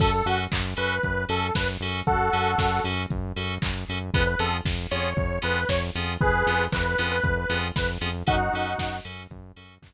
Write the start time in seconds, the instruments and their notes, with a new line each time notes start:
0.00 synth bass 1 F#2, electric piano 2 C#4 F#4 A4, lead 2 (sawtooth) A4, kick, crash
0.13 lead 2 (sawtooth) A4
0.25 synth bass 1 F#2, electric piano 2 C#4 F#4 A4, lead 2 (sawtooth) F#4, open hi-hat
0.52 synth bass 1 F#2, kick, clap
0.77 synth bass 1 F#2, electric piano 2 C#4 F#4 A4, lead 2 (sawtooth) B4, open hi-hat
1.03 synth bass 1 F#2, kick, closed hi-hat
1.29 synth bass 1 F#2, electric piano 2 C#4 F#4 A4, lead 2 (sawtooth) A4, open hi-hat
1.55 synth bass 1 F#2, lead 2 (sawtooth) B4, kick, snare
1.80 synth bass 1 F#2, electric piano 2 C#4 F#4 A4, open hi-hat
2.07 synth bass 1 F#2, lead 2 (sawtooth) F#4 A4, kick, closed hi-hat
2.33 synth bass 1 F#2, electric piano 2 C#4 F#4 A4, open hi-hat
2.58 synth bass 1 F#2, kick, snare
2.84 synth bass 1 F#2, electric piano 2 C#4 F#4 A4, open hi-hat
3.10 synth bass 1 F#2, kick, closed hi-hat
3.36 synth bass 1 F#2, electric piano 2 C#4 F#4 A4, open hi-hat
3.62 synth bass 1 F#2, kick, clap
3.88 synth bass 1 F#2, electric piano 2 C#4 F#4 A4, open hi-hat
4.14 synth bass 1 F2, electric piano 2 B3 C#4 F4 G#4, lead 2 (sawtooth) B4, kick, closed hi-hat
4.27 lead 2 (sawtooth) B4
4.39 synth bass 1 F2, electric piano 2 B3 C#4 F4 G#4, lead 2 (sawtooth) A4, open hi-hat
4.65 synth bass 1 F2, kick, snare
4.91 synth bass 1 F2, electric piano 2 B3 C#4 F4 G#4, lead 2 (sawtooth) C#5, open hi-hat
5.17 synth bass 1 F2, kick
5.42 synth bass 1 F2, electric piano 2 B3 C#4 F4 G#4, lead 2 (sawtooth) B4, closed hi-hat
5.69 synth bass 1 F2, lead 2 (sawtooth) C#5, kick, snare
5.95 synth bass 1 F2, electric piano 2 B3 C#4 F4 G#4, open hi-hat
6.21 synth bass 1 F2, lead 2 (sawtooth) G#4 B4, kick, closed hi-hat
6.46 synth bass 1 F2, electric piano 2 B3 C#4 F4 G#4, open hi-hat
6.72 synth bass 1 F2, lead 2 (sawtooth) B4, kick, clap
6.85 lead 2 (sawtooth) B4
6.98 synth bass 1 F2, electric piano 2 B3 C#4 F4 G#4, open hi-hat
7.11 lead 2 (sawtooth) B4
7.23 synth bass 1 F2, kick, closed hi-hat
7.37 lead 2 (sawtooth) B4
7.50 synth bass 1 F2, electric piano 2 B3 C#4 F4 G#4, open hi-hat
7.76 synth bass 1 F2, lead 2 (sawtooth) B4, kick, snare
8.01 synth bass 1 F2, electric piano 2 B3 C#4 F4 G#4, open hi-hat
8.27 synth bass 1 F#2, electric piano 2 C#4 F#4 A4, lead 2 (sawtooth) D#4 F#4, kick, closed hi-hat
8.53 synth bass 1 F#2, electric piano 2 C#4 F#4 A4, open hi-hat
8.78 synth bass 1 F#2, kick, snare
9.05 synth bass 1 F#2, electric piano 2 C#4 F#4 A4, open hi-hat
9.30 synth bass 1 F#2, kick, closed hi-hat
9.56 synth bass 1 F#2, electric piano 2 C#4 F#4 A4, open hi-hat
9.82 synth bass 1 F#2, kick, clap